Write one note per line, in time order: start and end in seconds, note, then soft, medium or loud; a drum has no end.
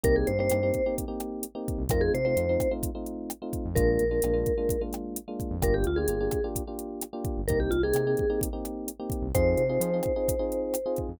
0.03 0.25 C2 medium
0.03 0.31 A#3 loud
0.03 0.31 C4 loud
0.03 0.31 D#4 loud
0.03 0.31 G4 loud
0.03 0.16 A#4 medium
0.03 kick medium
0.03 closed hi-hat medium
0.16 0.27 G#4 medium
0.27 0.49 G2 medium
0.27 0.38 C5 medium
0.27 closed hi-hat medium
0.39 0.48 A#3 medium
0.39 0.48 C4 loud
0.39 0.48 D#4 loud
0.39 0.48 G4 loud
0.39 0.95 C5 medium
0.50 0.72 G2 medium
0.50 0.59 A#3 loud
0.50 0.59 C4 loud
0.50 0.59 D#4 loud
0.50 0.59 G4 loud
0.50 cross-stick medium
0.50 closed hi-hat medium
0.63 0.81 A#3 medium
0.63 0.81 C4 loud
0.63 0.81 D#4 loud
0.63 0.81 G4 medium
0.74 kick medium
0.74 closed hi-hat medium
0.86 1.05 A#3 loud
0.86 1.05 C4 medium
0.86 1.05 D#4 medium
0.86 1.05 G4 loud
0.98 kick medium
0.98 closed hi-hat medium
1.08 1.45 A#3 loud
1.08 1.45 C4 medium
1.08 1.45 D#4 medium
1.08 1.45 G4 loud
1.20 cross-stick medium
1.20 closed hi-hat medium
1.43 closed hi-hat medium
1.55 1.83 A#3 loud
1.55 1.83 C4 loud
1.55 1.83 D#4 loud
1.55 1.83 G4 loud
1.68 kick medium
1.68 closed hi-hat medium
1.78 1.89 C2 medium
1.89 2.10 F2 medium
1.89 2.18 A3 loud
1.89 2.18 C4 loud
1.89 2.18 D#4 loud
1.89 2.18 F4 loud
1.89 2.02 A#4 medium
1.89 kick medium
1.89 cross-stick medium
1.89 closed hi-hat medium
2.01 2.12 G#4 medium
2.14 2.35 C3 medium
2.14 2.24 C5 medium
2.14 closed hi-hat medium
2.25 2.35 A3 loud
2.25 2.35 C4 loud
2.25 2.35 D#4 medium
2.25 2.35 F4 loud
2.25 2.73 C5 medium
2.37 2.57 F2 medium
2.37 2.46 A3 medium
2.37 2.46 C4 loud
2.37 2.46 D#4 medium
2.37 2.46 F4 loud
2.37 closed hi-hat medium
2.49 2.68 A3 medium
2.49 2.68 C4 loud
2.49 2.68 D#4 loud
2.49 2.68 F4 loud
2.60 kick medium
2.60 cross-stick medium
2.60 closed hi-hat medium
2.71 2.90 A3 loud
2.71 2.90 C4 medium
2.71 2.90 D#4 loud
2.71 2.90 F4 loud
2.83 kick medium
2.83 closed hi-hat medium
2.95 3.32 A3 medium
2.95 3.32 C4 medium
2.95 3.32 D#4 loud
2.95 3.32 F4 medium
3.06 closed hi-hat medium
3.30 cross-stick medium
3.30 closed hi-hat medium
3.42 3.70 A3 loud
3.42 3.70 C4 medium
3.42 3.70 D#4 medium
3.42 3.70 F4 loud
3.53 kick medium
3.53 closed hi-hat medium
3.65 3.76 F2 medium
3.75 3.98 A#1 loud
3.75 4.04 G#3 loud
3.75 4.04 A#3 loud
3.75 4.04 D4 loud
3.75 4.04 F4 loud
3.75 4.82 A#4 medium
3.75 kick medium
3.75 closed hi-hat medium
3.99 4.21 A#1 medium
3.99 closed hi-hat medium
4.11 4.20 G#3 medium
4.11 4.20 A#3 medium
4.11 4.20 D4 loud
4.11 4.20 F4 medium
4.22 4.44 A#1 medium
4.22 4.33 G#3 medium
4.22 4.33 A#3 loud
4.22 4.33 D4 loud
4.22 4.33 F4 medium
4.22 cross-stick medium
4.22 closed hi-hat medium
4.34 4.52 G#3 loud
4.34 4.52 A#3 medium
4.34 4.52 D4 loud
4.34 4.52 F4 loud
4.46 kick medium
4.46 closed hi-hat medium
4.58 4.76 G#3 loud
4.58 4.76 A#3 medium
4.58 4.76 D4 loud
4.58 4.76 F4 loud
4.69 kick medium
4.69 closed hi-hat medium
4.81 5.19 G#3 loud
4.81 5.19 A#3 loud
4.81 5.19 D4 medium
4.81 5.19 F4 medium
4.93 cross-stick medium
4.93 closed hi-hat medium
5.16 closed hi-hat medium
5.28 5.56 G#3 loud
5.28 5.56 A#3 loud
5.28 5.56 D4 loud
5.28 5.56 F4 medium
5.40 kick medium
5.40 closed hi-hat medium
5.51 5.61 F2 medium
5.62 5.84 G1 loud
5.62 5.90 A#3 loud
5.62 5.90 D4 loud
5.62 5.90 F4 loud
5.62 5.90 G4 loud
5.62 5.75 A#4 medium
5.62 kick medium
5.62 cross-stick medium
5.62 closed hi-hat medium
5.74 5.85 G4 medium
5.84 6.07 D2 medium
5.84 5.98 F4 medium
5.84 closed hi-hat medium
5.96 6.07 A#3 medium
5.96 6.07 D4 medium
5.96 6.07 F4 loud
5.96 6.07 G4 medium
5.96 6.47 G#4 medium
6.08 6.29 G1 medium
6.08 6.18 A#3 loud
6.08 6.18 D4 medium
6.08 6.18 F4 loud
6.08 6.18 G4 medium
6.08 closed hi-hat medium
6.20 6.39 A#3 medium
6.20 6.39 D4 loud
6.20 6.39 F4 medium
6.20 6.39 G4 loud
6.31 kick medium
6.31 cross-stick medium
6.31 closed hi-hat medium
6.44 6.63 A#3 medium
6.44 6.63 D4 loud
6.44 6.63 F4 medium
6.44 6.63 G4 loud
6.56 kick medium
6.56 closed hi-hat medium
6.67 7.05 A#3 medium
6.67 7.05 D4 medium
6.67 7.05 F4 medium
6.67 7.05 G4 medium
6.79 closed hi-hat medium
7.01 cross-stick medium
7.01 closed hi-hat medium
7.13 7.41 A#3 loud
7.13 7.41 D4 loud
7.13 7.41 F4 medium
7.13 7.41 G4 loud
7.25 kick medium
7.25 closed hi-hat medium
7.37 7.48 G1 medium
7.48 7.69 C2 medium
7.48 7.77 A#3 loud
7.48 7.77 C4 loud
7.48 7.77 D#4 loud
7.48 7.77 G4 loud
7.48 7.59 A#4 medium
7.48 kick medium
7.48 closed hi-hat medium
7.60 7.71 G4 medium
7.71 7.92 C2 medium
7.71 7.82 F4 medium
7.71 closed hi-hat medium
7.83 7.93 A#3 medium
7.83 7.93 C4 loud
7.83 7.93 D#4 loud
7.83 7.93 G4 loud
7.83 8.40 G#4 medium
7.94 8.15 C3 medium
7.94 8.04 A#3 loud
7.94 8.04 C4 loud
7.94 8.04 D#4 loud
7.94 8.04 G4 loud
7.94 cross-stick medium
7.94 closed hi-hat medium
8.07 8.25 A#3 loud
8.07 8.25 C4 loud
8.07 8.25 D#4 loud
8.07 8.25 G4 loud
8.17 kick medium
8.17 closed hi-hat medium
8.30 8.48 A#3 loud
8.30 8.48 C4 loud
8.30 8.48 D#4 loud
8.30 8.48 G4 medium
8.41 kick medium
8.41 closed hi-hat loud
8.53 8.90 A#3 medium
8.53 8.90 C4 loud
8.53 8.90 D#4 loud
8.53 8.90 G4 medium
8.65 cross-stick medium
8.65 closed hi-hat medium
8.88 closed hi-hat medium
9.00 9.27 A#3 loud
9.00 9.27 C4 loud
9.00 9.27 D#4 medium
9.00 9.27 G4 loud
9.10 kick medium
9.10 closed hi-hat medium
9.22 9.32 C2 medium
9.34 9.55 F2 medium
9.34 9.63 C4 loud
9.34 9.63 D#4 loud
9.34 9.63 F4 loud
9.34 9.63 G#4 loud
9.34 10.99 C5 medium
9.34 kick medium
9.34 cross-stick medium
9.34 closed hi-hat medium
9.57 9.78 C3 medium
9.57 closed hi-hat medium
9.69 9.79 C4 loud
9.69 9.79 D#4 medium
9.69 9.79 F4 loud
9.69 9.79 G#4 medium
9.80 10.01 F3 medium
9.80 9.90 C4 medium
9.80 9.90 D#4 loud
9.80 9.90 F4 loud
9.80 9.90 G#4 loud
9.80 closed hi-hat medium
9.94 10.12 C4 loud
9.94 10.12 D#4 medium
9.94 10.12 F4 medium
9.94 10.12 G#4 medium
10.03 kick medium
10.03 cross-stick medium
10.03 closed hi-hat medium
10.16 10.35 C4 medium
10.16 10.35 D#4 loud
10.16 10.35 F4 medium
10.16 10.35 G#4 loud
10.28 kick medium
10.28 closed hi-hat medium
10.39 10.76 C4 loud
10.39 10.76 D#4 loud
10.39 10.76 F4 medium
10.39 10.76 G#4 loud
10.52 closed hi-hat medium
10.74 cross-stick medium
10.74 closed hi-hat medium
10.86 11.14 C4 medium
10.86 11.14 D#4 medium
10.86 11.14 F4 loud
10.86 11.14 G#4 loud
10.96 kick medium
10.96 closed hi-hat medium
11.08 11.19 F2 medium